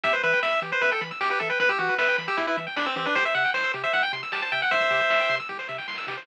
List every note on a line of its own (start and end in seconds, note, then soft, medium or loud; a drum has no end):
0.03 0.14 E2 loud
0.03 0.12 G4 medium
0.03 0.13 E5 medium
0.03 kick loud
0.03 closed hi-hat loud
0.13 0.22 B4 medium
0.13 0.22 C5 medium
0.13 closed hi-hat medium
0.23 0.34 E3 loud
0.23 0.40 B4 medium
0.23 0.32 E5 medium
0.23 closed hi-hat medium
0.32 0.42 G5 medium
0.32 closed hi-hat medium
0.43 0.53 E2 medium
0.43 0.60 E5 medium
0.43 0.52 B5 medium
0.43 snare medium
0.53 0.61 E6 medium
0.53 closed hi-hat medium
0.62 0.73 E3 loud
0.62 0.71 G4 medium
0.62 closed hi-hat medium
0.72 0.81 B4 medium
0.72 0.82 C5 medium
0.72 closed hi-hat medium
0.81 0.92 E2 loud
0.81 0.91 B4 medium
0.81 0.91 E5 medium
0.81 kick medium
0.81 closed hi-hat medium
0.91 1.01 A4 medium
0.91 1.00 G5 medium
0.91 closed hi-hat medium
1.01 1.12 E3 loud
1.01 1.10 B5 medium
1.01 closed hi-hat medium
1.11 1.20 E6 medium
1.11 closed hi-hat medium
1.21 1.31 E2 medium
1.21 1.29 G4 medium
1.21 snare loud
1.30 1.39 G4 medium
1.30 1.39 B4 medium
1.30 closed hi-hat medium
1.40 1.51 E3 medium
1.40 1.49 A4 medium
1.40 1.49 E5 medium
1.40 kick medium
1.40 closed hi-hat medium
1.50 1.59 B4 medium
1.50 1.59 G5 medium
1.50 closed hi-hat medium
1.59 1.70 E2 medium
1.59 1.69 B4 medium
1.59 1.68 B5 medium
1.59 kick loud
1.59 closed hi-hat medium
1.69 1.78 G4 medium
1.69 1.78 E6 medium
1.69 kick medium
1.69 closed hi-hat medium
1.79 1.90 E3 loud
1.79 1.95 F#4 medium
1.79 1.88 G4 medium
1.79 closed hi-hat medium
1.89 1.98 B4 medium
1.89 closed hi-hat medium
1.98 2.09 E2 loud
1.98 2.17 B4 medium
1.98 2.07 E5 medium
1.98 snare loud
2.08 2.17 G5 medium
2.08 closed hi-hat medium
2.18 2.29 E3 medium
2.18 2.27 B5 medium
2.18 closed hi-hat medium
2.28 2.37 G4 medium
2.28 2.37 E6 medium
2.28 closed hi-hat medium
2.37 2.48 E2 medium
2.37 2.46 E4 medium
2.37 2.47 G4 medium
2.37 kick medium
2.37 closed hi-hat loud
2.47 2.57 E4 medium
2.47 2.56 B4 medium
2.47 closed hi-hat medium
2.57 2.68 E3 loud
2.57 2.66 E5 medium
2.57 closed hi-hat medium
2.67 2.76 G5 medium
2.67 closed hi-hat medium
2.76 2.87 E2 medium
2.76 2.86 D4 medium
2.76 2.85 B5 medium
2.76 snare loud
2.86 2.96 C4 medium
2.86 2.95 E6 medium
2.86 closed hi-hat medium
2.96 3.07 E3 loud
2.96 3.06 C4 medium
2.96 3.05 G4 medium
2.96 closed hi-hat medium
3.06 3.15 D4 medium
3.06 3.14 B4 medium
3.06 closed hi-hat medium
3.15 3.26 C2 loud
3.15 3.24 G4 medium
3.15 3.25 C5 loud
3.15 kick medium
3.15 closed hi-hat loud
3.25 3.34 C5 medium
3.25 3.35 E5 medium
3.25 closed hi-hat medium
3.34 3.46 C3 loud
3.34 3.43 E5 medium
3.34 3.51 F#5 medium
3.34 closed hi-hat medium
3.45 3.53 G5 medium
3.45 closed hi-hat medium
3.54 3.65 C2 loud
3.54 3.72 C5 medium
3.54 3.63 C6 medium
3.54 snare medium
3.64 3.73 E6 medium
3.64 closed hi-hat medium
3.74 3.85 C3 loud
3.74 3.83 G4 medium
3.74 closed hi-hat medium
3.83 3.92 C5 medium
3.83 3.93 E5 medium
3.83 closed hi-hat medium
3.93 4.04 C2 medium
3.93 4.02 E5 medium
3.93 4.03 F#5 medium
3.93 kick medium
3.93 closed hi-hat medium
4.03 4.12 G5 medium
4.03 closed hi-hat medium
4.13 4.23 C3 medium
4.13 4.22 C6 medium
4.13 closed hi-hat medium
4.23 4.32 E6 medium
4.23 closed hi-hat medium
4.32 4.43 C2 medium
4.32 4.41 G4 medium
4.32 4.42 A5 medium
4.32 snare loud
4.42 4.51 C5 medium
4.42 4.52 A5 medium
4.42 closed hi-hat medium
4.52 4.63 C3 medium
4.52 4.61 E5 medium
4.52 4.61 G5 medium
4.52 kick medium
4.52 closed hi-hat medium
4.61 4.71 F#5 medium
4.61 4.70 G5 medium
4.61 closed hi-hat medium
4.71 4.82 C2 loud
4.71 5.36 C5 medium
4.71 5.36 E5 medium
4.71 4.80 C6 medium
4.71 kick loud
4.71 closed hi-hat medium
4.81 4.90 E6 medium
4.81 kick medium
4.81 closed hi-hat medium
4.91 5.01 C3 medium
4.91 4.99 G4 medium
4.91 closed hi-hat medium
5.00 5.09 C5 medium
5.00 closed hi-hat medium
5.10 5.21 C2 loud
5.10 5.19 E5 medium
5.10 snare loud
5.20 5.29 G5 medium
5.20 closed hi-hat medium
5.29 5.40 C3 loud
5.29 5.38 C6 medium
5.29 closed hi-hat medium
5.39 5.48 E6 medium
5.39 closed hi-hat medium
5.49 5.60 C2 medium
5.49 5.58 G4 medium
5.49 kick medium
5.49 snare medium
5.59 5.68 C5 medium
5.59 snare medium
5.69 5.80 C3 medium
5.69 5.77 E5 medium
5.69 snare medium
5.78 5.87 G5 medium
5.78 snare medium
5.88 5.99 C2 medium
5.88 5.97 C6 medium
5.88 snare medium
5.93 snare medium
5.98 6.06 E6 medium
5.98 snare medium
6.03 snare medium
6.07 6.18 C3 medium
6.07 6.17 G4 medium
6.07 snare medium
6.12 snare medium
6.17 6.26 C5 medium
6.17 snare medium
6.22 snare medium